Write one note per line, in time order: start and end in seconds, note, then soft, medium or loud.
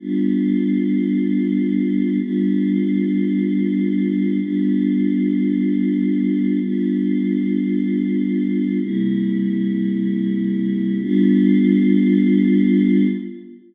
0.00 2.18 G3 medium
0.00 2.18 B3 medium
0.00 2.18 D4 medium
0.00 2.18 F4 medium
2.20 4.39 G3 medium
2.20 4.39 B3 medium
2.20 4.39 D4 medium
2.20 4.39 F4 medium
4.40 6.59 G3 medium
4.40 6.59 B3 medium
4.40 6.59 D4 medium
4.40 6.59 F4 medium
6.61 8.79 G3 medium
6.61 8.79 B3 medium
6.61 8.79 D4 medium
6.61 8.79 F4 medium
8.81 10.99 C3 medium
8.81 10.99 G3 medium
8.81 10.99 A#3 medium
8.81 10.99 E4 medium
11.01 13.06 G3 loud
11.01 13.06 B3 loud
11.01 13.06 D4 medium
11.01 13.06 F4 loud